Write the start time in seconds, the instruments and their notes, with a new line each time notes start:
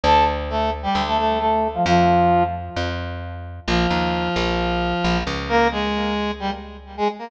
0.04 electric bass (finger) D2, brass section A4 A5
0.49 brass section A3 A4
0.83 brass section G3 G4
0.95 electric bass (finger) D2
1.07 brass section A3 A4
1.18 brass section A3 A4
1.39 brass section A3 A4
1.74 brass section F3 F4
1.86 electric bass (finger) F2, brass section F3 F4
2.76 electric bass (finger) F2
3.67 electric bass (finger) A#1, brass section F3 F4
3.90 electric bass (finger) D#2
4.36 electric bass (finger) A#1
5.04 electric bass (finger) A#1
5.27 electric bass (finger) C#2
5.49 brass section A#3 A#4
5.71 brass section G#3 G#4
6.40 brass section G3 G4
6.97 brass section G#3 G#4
7.19 brass section A#3 A#4